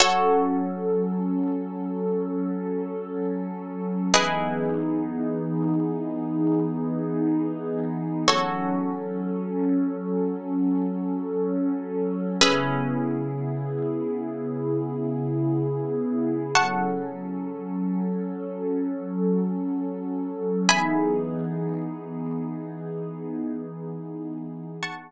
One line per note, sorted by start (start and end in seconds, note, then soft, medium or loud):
0.00 4.08 F#3 loud
0.00 4.08 C#4 medium
0.00 4.06 F#4 medium
0.00 4.08 A4 loud
0.00 4.06 A4 medium
0.00 4.06 C#5 medium
4.14 8.24 E3 medium
4.14 8.24 B3 loud
4.14 8.24 D#4 loud
4.14 8.19 E4 medium
4.14 8.19 G#4 medium
4.14 8.24 G#4 medium
4.14 8.19 B4 medium
4.14 8.19 D#5 medium
8.27 12.36 F#3 loud
8.27 12.36 C#4 loud
8.27 12.33 F#4 medium
8.27 12.36 A4 medium
8.27 12.33 A4 medium
8.27 12.33 C#5 medium
12.41 16.51 C#3 medium
12.41 16.51 B3 medium
12.41 16.47 C#4 medium
12.41 16.51 E4 medium
12.41 16.47 G#4 medium
12.41 16.51 G#4 medium
12.41 16.47 B4 medium
12.41 16.47 E5 medium
16.55 20.66 F#3 loud
16.55 20.66 C#4 medium
16.55 20.66 A4 medium
16.55 20.61 F#5 medium
16.55 20.61 A5 medium
16.55 20.61 C#6 medium
20.67 24.77 E3 loud
20.67 24.77 B3 loud
20.67 24.77 D#4 medium
20.67 24.77 G#4 loud
20.67 24.74 E5 medium
20.67 24.74 G#5 medium
20.67 24.74 B5 medium
20.67 24.74 D#6 medium
24.83 25.11 F#5 medium
24.83 25.11 A5 medium
24.83 25.11 C#6 medium